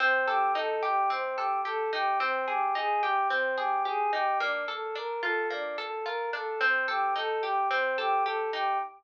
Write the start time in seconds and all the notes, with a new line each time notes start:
0.00 C4
0.27 G4 A4
0.55 D#4 A4
0.83 G4
1.10 C4
1.36 G4 A4
1.65 G4 A4
1.93 D#4 G4
2.20 C4
2.48 G4 G#4
2.75 D#4 G#4
3.02 G4
3.30 C4
3.57 G4 G#4
3.85 G4 G#4
4.12 D#4 G4
4.40 A#3 D4
4.68 A4
4.95 D4 A#4
5.23 F4 A4
5.50 A#3 D4
5.78 A4
6.05 F4 A#4
6.33 D4 A4
6.61 C4
6.88 G4 A4
7.16 D#4 A4
7.43 G4
7.71 C4
7.98 G4 A4
8.25 G4 A4
8.53 D#4 G4